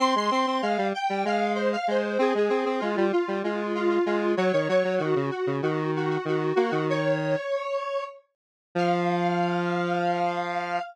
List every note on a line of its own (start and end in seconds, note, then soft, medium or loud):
0.00 0.15 C4 medium
0.00 0.14 C6 loud
0.15 0.30 G#3 medium
0.15 0.32 C6 loud
0.31 0.46 C4 medium
0.31 0.61 C6 loud
0.47 0.62 C4 medium
0.62 0.77 G#3 medium
0.62 0.87 F5 loud
0.78 0.93 G3 medium
0.94 1.24 G5 loud
1.10 1.24 G3 medium
1.25 1.76 G#3 medium
1.25 1.53 F5 loud
1.55 1.70 C5 loud
1.73 1.87 F5 loud
1.88 2.18 G#3 medium
1.88 2.18 C5 loud
2.19 2.33 C4 medium
2.19 2.35 G#4 loud
2.35 2.49 G#3 medium
2.35 2.48 G#4 loud
2.49 2.65 C4 medium
2.49 2.75 G#4 loud
2.66 2.80 C4 medium
2.80 2.96 G#3 medium
2.80 3.05 F4 loud
2.97 3.12 G3 medium
3.12 3.38 F4 loud
3.28 3.43 G3 medium
3.44 3.99 G#3 medium
3.44 3.72 F4 medium
3.75 3.89 F4 loud
3.90 4.05 F4 loud
4.06 4.35 G#3 medium
4.06 4.32 F4 loud
4.37 4.52 F#3 loud
4.37 4.52 C#5 loud
4.53 4.68 D#3 medium
4.53 4.68 C#5 loud
4.69 4.84 F#3 medium
4.69 4.95 C#5 loud
4.84 4.99 F#3 medium
4.98 5.15 D#3 medium
4.98 5.28 F#4 loud
5.16 5.31 C#3 medium
5.31 5.56 F#4 medium
5.47 5.62 C#3 medium
5.62 6.18 D#3 medium
5.62 5.91 F#4 medium
5.96 6.09 F#4 loud
6.10 6.25 F#4 loud
6.25 6.53 D#3 medium
6.25 6.55 F#4 loud
6.55 6.71 A#3 medium
6.55 6.70 F#4 loud
6.70 7.36 D#3 medium
6.70 6.85 F#4 loud
6.90 8.04 C#5 loud
8.75 10.79 F3 loud
8.75 10.82 F5 loud